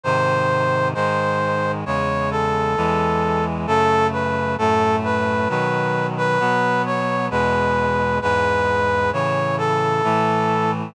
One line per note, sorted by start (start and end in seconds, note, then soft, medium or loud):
0.03 0.94 G#2 medium
0.03 0.94 C3 medium
0.03 0.94 D#3 medium
0.03 0.88 C5 loud
0.94 1.84 G#2 medium
0.94 1.84 D#3 medium
0.94 1.84 G#3 medium
0.94 1.72 C5 loud
1.86 2.76 E2 medium
1.86 2.76 C#3 medium
1.86 2.76 G#3 medium
1.86 2.30 C#5 medium
2.31 3.45 A4 medium
2.77 3.67 E2 medium
2.77 3.67 E3 medium
2.77 3.67 G#3 medium
3.67 4.57 F#2 medium
3.67 4.57 C#3 medium
3.67 4.57 A3 medium
3.67 4.07 A4 loud
4.12 4.55 B4 medium
4.58 5.48 F#2 medium
4.58 5.48 A2 medium
4.58 5.48 A3 medium
4.58 4.96 A4 loud
5.04 5.48 B4 medium
5.49 6.39 B2 medium
5.49 6.39 D#3 medium
5.49 6.39 F#3 medium
5.49 6.07 B4 medium
6.17 6.82 B4 loud
6.40 7.30 B2 medium
6.40 7.30 F#3 medium
6.40 7.30 B3 medium
6.86 7.26 C#5 medium
7.30 8.20 E2 medium
7.30 8.20 B2 medium
7.30 8.20 G#3 medium
7.30 8.19 B4 loud
8.22 9.12 E2 medium
8.22 9.12 G#2 medium
8.22 9.12 G#3 medium
8.22 9.10 B4 loud
9.13 10.02 A2 medium
9.13 10.02 C#3 medium
9.13 10.02 E3 medium
9.13 9.56 C#5 loud
9.58 10.71 A4 loud
10.04 10.94 A2 medium
10.04 10.94 E3 medium
10.04 10.94 A3 medium